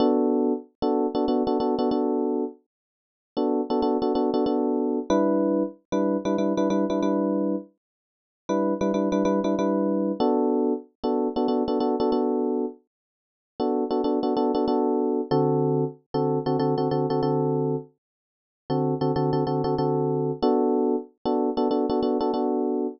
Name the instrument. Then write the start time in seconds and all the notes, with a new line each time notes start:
electric piano 1
0.00 B3 D4 F#4 A4
0.82 B3 D4 F#4 A4
1.15 B3 D4 F#4 A4
1.28 B3 D4 F#4 A4
1.47 B3 D4 F#4 A4
1.60 B3 D4 F#4 A4
1.79 B3 D4 F#4 A4
1.91 B3 D4 F#4 A4
3.37 B3 D4 F#4 A4
3.70 B3 D4 F#4 A4
3.82 B3 D4 F#4 A4
4.02 B3 D4 F#4 A4
4.15 B3 D4 F#4 A4
4.34 B3 D4 F#4 A4
4.46 B3 D4 F#4 A4
5.10 G3 D4 E4 B4
5.92 G3 D4 E4 B4
6.25 G3 D4 E4 B4
6.38 G3 D4 E4 B4
6.57 G3 D4 E4 B4
6.70 G3 D4 E4 B4
6.90 G3 D4 E4 B4
7.03 G3 D4 E4 B4
8.49 G3 D4 E4 B4
8.81 G3 D4 E4 B4
8.94 G3 D4 E4 B4
9.12 G3 D4 E4 B4
9.25 G3 D4 E4 B4
9.44 G3 D4 E4 B4
9.59 G3 D4 E4 B4
10.20 B3 D4 F#4 A4
11.04 B3 D4 F#4 A4
11.36 B3 D4 F#4 A4
11.48 B3 D4 F#4 A4
11.68 B3 D4 F#4 A4
11.80 B3 D4 F#4 A4
12.00 B3 D4 F#4 A4
12.12 B3 D4 F#4 A4
13.60 B3 D4 F#4 A4
13.91 B3 D4 F#4 A4
14.04 B3 D4 F#4 A4
14.23 B3 D4 F#4 A4
14.37 B3 D4 F#4 A4
14.55 B3 D4 F#4 A4
14.68 B3 D4 F#4 A4
15.31 D3 C4 F#4 A4
16.14 D3 C4 F#4 A4
16.46 D3 C4 F#4 A4
16.59 D3 C4 F#4 A4
16.78 D3 C4 F#4 A4
16.91 D3 C4 F#4 A4
17.10 D3 C4 F#4 A4
17.23 D3 C4 F#4 A4
18.70 D3 C4 F#4 A4
19.01 D3 C4 F#4 A4
19.16 D3 C4 F#4 A4
19.33 D3 C4 F#4 A4
19.47 D3 C4 F#4 A4
19.64 D3 C4 F#4 A4
19.78 D3 C4 F#4 A4
20.42 B3 D4 F#4 A4
21.25 B3 D4 F#4 A4
21.57 B3 D4 F#4 A4
21.71 B3 D4 F#4 A4
21.89 B3 D4 F#4 A4
22.03 B3 D4 F#4 A4
22.20 B3 D4 F#4 A4
22.34 B3 D4 F#4 A4